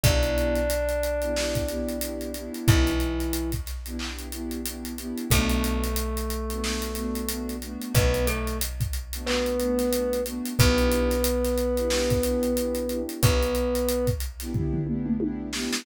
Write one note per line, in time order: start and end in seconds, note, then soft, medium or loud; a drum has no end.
0.03 2.48 B1 medium
0.03 0.59 B3 medium
0.03 2.49 D4 medium
0.03 0.59 D4 medium
0.03 0.59 E4 medium
0.03 0.59 G4 medium
0.03 2.49 D5 medium
0.03 kick loud
0.03 closed hi-hat loud
0.23 closed hi-hat medium
0.38 closed hi-hat medium
0.55 closed hi-hat medium
0.70 closed hi-hat loud
0.89 closed hi-hat medium
1.03 closed hi-hat medium
1.22 1.33 B3 medium
1.22 1.33 D4 medium
1.22 1.33 E4 medium
1.22 1.33 G4 medium
1.22 closed hi-hat medium
1.36 1.63 B3 medium
1.36 1.63 D4 medium
1.36 1.63 E4 medium
1.36 1.63 G4 medium
1.36 snare loud
1.55 kick medium
1.55 closed hi-hat medium
1.68 1.96 B3 medium
1.68 1.96 D4 medium
1.68 1.96 E4 medium
1.68 1.96 G4 medium
1.68 closed hi-hat medium
1.88 closed hi-hat medium
2.01 2.29 B3 medium
2.01 2.29 D4 medium
2.01 2.29 E4 medium
2.01 2.29 G4 medium
2.01 closed hi-hat loud
2.21 closed hi-hat medium
2.34 2.90 B3 medium
2.34 2.90 D4 medium
2.34 2.90 E4 medium
2.34 2.90 G4 medium
2.34 closed hi-hat medium
2.54 closed hi-hat medium
2.68 5.12 B1 medium
2.68 3.50 E3 medium
2.68 3.50 E4 medium
2.68 kick loud
2.68 closed hi-hat loud
2.86 snare soft
2.86 closed hi-hat medium
3.00 closed hi-hat medium
3.20 closed hi-hat medium
3.33 closed hi-hat loud
3.52 kick medium
3.52 closed hi-hat medium
3.66 snare soft
3.66 closed hi-hat medium
3.86 3.97 B3 medium
3.86 3.97 D4 medium
3.86 3.97 E4 medium
3.86 3.97 G4 medium
3.86 closed hi-hat medium
3.99 4.27 B3 medium
3.99 4.27 D4 medium
3.99 4.27 E4 medium
3.99 4.27 G4 medium
3.99 clap loud
4.19 closed hi-hat medium
4.32 4.60 B3 medium
4.32 4.60 D4 medium
4.32 4.60 E4 medium
4.32 4.60 G4 medium
4.32 closed hi-hat medium
4.51 closed hi-hat medium
4.65 4.93 B3 medium
4.65 4.93 D4 medium
4.65 4.93 E4 medium
4.65 4.93 G4 medium
4.65 closed hi-hat loud
4.85 closed hi-hat medium
4.98 5.25 B3 medium
4.98 5.25 D4 medium
4.98 5.25 E4 medium
4.98 5.25 G4 medium
4.98 closed hi-hat medium
5.17 closed hi-hat medium
5.30 7.76 B1 medium
5.30 5.86 A3 medium
5.30 7.55 A3 medium
5.30 5.86 B3 medium
5.30 5.86 D4 medium
5.30 5.86 F#4 medium
5.30 7.55 A4 medium
5.30 kick loud
5.30 closed hi-hat loud
5.49 closed hi-hat medium
5.64 closed hi-hat loud
5.84 closed hi-hat medium
5.96 closed hi-hat loud
6.17 closed hi-hat medium
6.30 closed hi-hat medium
6.50 6.61 A3 medium
6.50 6.61 B3 medium
6.50 6.61 D4 medium
6.50 6.61 F#4 medium
6.50 closed hi-hat medium
6.63 6.91 A3 medium
6.63 6.91 B3 medium
6.63 6.91 D4 medium
6.63 6.91 F#4 medium
6.63 snare loud
6.82 closed hi-hat medium
6.95 7.23 A3 medium
6.95 7.23 B3 medium
6.95 7.23 D4 medium
6.95 7.23 F#4 medium
6.95 closed hi-hat medium
7.15 closed hi-hat medium
7.28 7.57 A3 medium
7.28 7.57 B3 medium
7.28 7.57 D4 medium
7.28 7.57 F#4 medium
7.28 closed hi-hat loud
7.49 closed hi-hat medium
7.62 8.17 A3 medium
7.62 8.17 B3 medium
7.62 8.17 D4 medium
7.62 8.17 F#4 medium
7.62 closed hi-hat medium
7.81 closed hi-hat medium
7.95 10.39 B1 medium
7.95 8.26 B3 medium
7.95 8.26 B4 loud
7.95 kick loud
7.95 closed hi-hat loud
8.14 closed hi-hat medium
8.27 8.57 A3 medium
8.27 8.57 A4 medium
8.27 closed hi-hat loud
8.47 closed hi-hat medium
8.61 closed hi-hat loud
8.80 kick loud
8.80 closed hi-hat medium
8.93 closed hi-hat medium
9.13 9.24 A3 medium
9.13 9.24 B3 medium
9.13 9.24 D4 medium
9.13 9.24 F#4 medium
9.13 closed hi-hat loud
9.26 9.54 A3 medium
9.26 10.20 B3 medium
9.26 9.54 B3 medium
9.26 9.54 D4 medium
9.26 9.54 F#4 medium
9.26 10.20 B4 medium
9.26 clap loud
9.46 closed hi-hat medium
9.59 9.88 A3 medium
9.59 9.88 B3 medium
9.59 9.88 D4 medium
9.59 9.88 F#4 medium
9.59 closed hi-hat medium
9.79 snare soft
9.79 closed hi-hat medium
9.92 10.20 A3 medium
9.92 10.20 B3 medium
9.92 10.20 D4 medium
9.92 10.20 F#4 medium
9.92 closed hi-hat loud
10.13 closed hi-hat medium
10.26 10.53 A3 medium
10.26 10.53 B3 medium
10.26 10.53 D4 medium
10.26 10.53 F#4 medium
10.26 closed hi-hat medium
10.45 closed hi-hat medium
10.59 13.04 B1 medium
10.59 11.14 B3 medium
10.59 13.01 B3 loud
10.59 11.14 D4 medium
10.59 11.14 E4 medium
10.59 11.14 G4 medium
10.59 13.01 B4 loud
10.59 kick loud
10.59 closed hi-hat loud
10.78 closed hi-hat medium
10.91 closed hi-hat loud
11.10 snare soft
11.10 closed hi-hat medium
11.24 closed hi-hat loud
11.44 snare soft
11.44 closed hi-hat medium
11.58 closed hi-hat medium
11.77 11.88 B3 medium
11.77 11.88 D4 medium
11.77 11.88 E4 medium
11.77 11.88 G4 medium
11.77 closed hi-hat medium
11.90 12.18 B3 medium
11.90 12.18 D4 medium
11.90 12.18 E4 medium
11.90 12.18 G4 medium
11.90 snare loud
12.10 kick loud
12.10 closed hi-hat medium
12.23 12.51 B3 medium
12.23 12.51 D4 medium
12.23 12.51 E4 medium
12.23 12.51 G4 medium
12.23 closed hi-hat loud
12.43 closed hi-hat medium
12.56 12.84 B3 medium
12.56 12.84 D4 medium
12.56 12.84 E4 medium
12.56 12.84 G4 medium
12.56 closed hi-hat loud
12.75 closed hi-hat medium
12.89 13.44 B3 medium
12.89 13.44 D4 medium
12.89 13.44 E4 medium
12.89 13.44 G4 medium
12.89 closed hi-hat medium
13.09 closed hi-hat medium
13.23 15.68 B1 medium
13.23 14.06 B3 medium
13.23 14.06 B4 loud
13.23 kick loud
13.23 closed hi-hat loud
13.42 closed hi-hat medium
13.55 closed hi-hat medium
13.75 closed hi-hat medium
13.88 closed hi-hat loud
14.07 kick loud
14.07 closed hi-hat medium
14.20 closed hi-hat medium
14.40 14.52 B3 medium
14.40 14.52 D4 medium
14.40 14.52 E4 medium
14.40 14.52 G4 medium
14.40 snare soft
14.40 closed hi-hat medium
14.54 14.81 B3 medium
14.54 14.81 D4 medium
14.54 14.81 E4 medium
14.54 14.81 G4 medium
14.54 kick medium
14.54 floor tom loud
14.73 floor tom loud
14.87 15.15 B3 medium
14.87 15.15 D4 medium
14.87 15.15 E4 medium
14.87 15.15 G4 medium
14.87 mid tom medium
15.06 mid tom loud
15.20 15.48 B3 medium
15.20 15.48 D4 medium
15.20 15.48 E4 medium
15.20 15.48 G4 medium
15.20 high tom loud
15.53 15.81 B3 medium
15.53 15.81 D4 medium
15.53 15.81 E4 medium
15.53 15.81 G4 medium
15.53 snare loud
15.73 snare loud